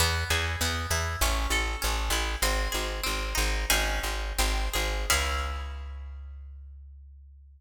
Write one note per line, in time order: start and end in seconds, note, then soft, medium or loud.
0.00 0.24 E2 loud
0.00 0.61 B3 loud
0.30 0.56 E2 loud
0.30 1.17 G#4 medium
0.61 0.86 E2 loud
0.61 1.19 B3 medium
0.91 1.16 E2 medium
0.91 1.20 E4 medium
1.21 1.47 A1 loud
1.21 1.81 C#4 loud
1.50 1.76 A1 medium
1.50 2.38 A4 medium
1.82 2.10 A1 loud
1.82 2.40 C#4 medium
2.10 2.36 A1 loud
2.10 2.41 E4 medium
2.42 2.68 G#1 loud
2.42 3.03 C4 loud
2.72 3.01 G#1 medium
2.72 3.64 G#4 medium
3.03 3.34 G#1 medium
3.03 3.65 C4 medium
3.35 3.65 G#1 loud
3.35 3.66 D#4 medium
3.70 4.00 G#1 loud
3.70 4.31 C#4 medium
3.70 4.31 D#4 loud
3.70 4.31 G#4 loud
4.03 4.33 G#1 medium
4.38 4.69 G#1 loud
4.38 5.07 C4 loud
4.73 5.06 G#1 medium
4.73 5.08 G#4 medium
5.10 7.61 C#2 loud
5.10 7.61 C#4 loud
5.10 7.61 E4 loud
5.10 7.61 G#4 loud